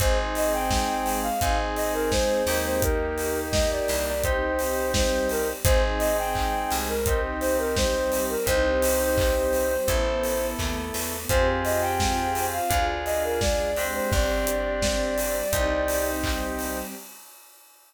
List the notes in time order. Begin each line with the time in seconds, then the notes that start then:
0.00 G#1 C4 D#4 G#4 C5, kick, closed hi-hat
0.35 D#5, open hi-hat
0.53 G5
0.70 G#3 C4 G#4, kick, snare
1.06 open hi-hat
1.23 F5
1.41 G#1 C4 D#4 G#4, kick, closed hi-hat
1.76 D#5, open hi-hat
1.94 A#4
2.11 G#3 C4 G#4 C5, kick, snare
2.47 D#2 A#3 D#4 G4, open hi-hat
2.65 C5
2.81 A#3 D#4 G4 A#4, kick, closed hi-hat
3.18 open hi-hat
3.52 A#3 G4 A#4 D#5, kick, snare
3.71 D5
3.88 C2, open hi-hat
4.06 D5
4.23 C4 D#4 G4 C5, kick, closed hi-hat
4.59 open hi-hat
4.94 G3 C4 G4 C5, kick, snare
5.29 A#4, open hi-hat
5.64 G#1 C4 D#4 G#4 C5, kick, closed hi-hat
5.99 D#5, open hi-hat
6.18 G5
6.35 G#3 C4 G#4, kick, clap
6.71 C2, open hi-hat
6.89 A#4
7.06 C4 D#4 G4, kick, closed hi-hat
7.41 C5, open hi-hat
7.58 A#4
7.76 G3 C4 G4 C5, kick, snare
8.12 open hi-hat
8.29 A#4
8.46 C2 C4 D#4 G4 C5, kick, closed hi-hat
8.82 open hi-hat
9.18 G3 C4 G4, kick, clap
9.53 open hi-hat
9.88 A1 B3 E4 A4, kick, closed hi-hat
10.24 open hi-hat
10.59 D#2 A3 B3 A4, kick, clap
10.94 E2, open hi-hat
11.29 F2 C4 F4 G4 G#4 C5, kick, closed hi-hat
11.64 D#5, open hi-hat
11.81 G5
12.00 C4 F4 G#4 C5, kick, snare
12.35 open hi-hat
12.53 F5
12.70 D2 D4 F4 G#4, kick, closed hi-hat
13.05 D#5, open hi-hat
13.24 A#4
13.41 G#3 D4 G#4 D5, kick, snare
13.76 C4 D4 G4, open hi-hat
13.94 C5
14.11 G1 C4 D4 G4 D5, kick
14.47 closed hi-hat
14.82 G3 C4 G4, kick, snare
15.18 open hi-hat
15.52 C2 C4 D#4 G4, kick, closed hi-hat
15.88 open hi-hat
16.24 G3 C4 G4, kick, clap
16.59 open hi-hat